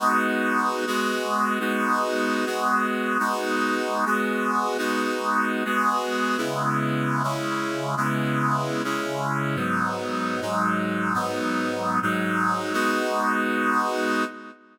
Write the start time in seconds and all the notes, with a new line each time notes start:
0.00 G#3 B3 D#4 F#4
0.87 G#3 B3 F#4 G#4
1.60 G#3 B3 D#4 F#4
2.46 G#3 B3 F#4 G#4
3.19 G#3 B3 D#4 F#4
4.05 G#3 B3 F#4 G#4
4.78 G#3 B3 D#4 F#4
5.65 G#3 B3 F#4 G#4
6.37 C#3 G#3 B3 E4
7.23 C#3 G#3 C#4 E4
7.97 C#3 G#3 B3 E4
8.84 C#3 G#3 C#4 E4
9.55 G#2 F#3 B3 D#4
10.41 G#2 F#3 G#3 D#4
11.14 G#2 F#3 B3 D#4
12.02 G#2 F#3 G#3 D#4
12.73 G#3 B3 D#4 F#4